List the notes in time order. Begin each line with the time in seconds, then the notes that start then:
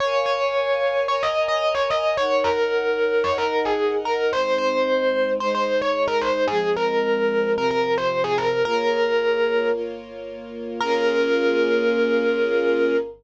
0.00 A#4 C#5 F5 G#5
0.26 C#5
1.07 A#4 C#5 G#5 A#5
1.23 D#5
1.48 D#5
1.75 C#5
1.90 D#5
2.17 D#4 A#4 C#5 F#5
2.44 A#4
3.24 D#4 A#4 C#5 D#5 F#5
3.38 A#4
3.65 G#4
4.05 A#4
4.32 G#3 C4 D#4 C5
4.58 C5
5.40 G#3 D#4 G#4 C5
5.55 C5
5.81 C#5
6.08 A#4
6.21 C5
6.48 F3 G#3 C4 G#4
6.76 A#4
7.55 C3 F3 C4 A#4
7.71 A#4
7.98 C5
8.24 G#4
8.38 A#4
8.65 A#3 F4 G#4 A#4 C#5
9.73 A#3 F4 A#4 C#5
10.81 A#3 C#4 F4 G#4 A#4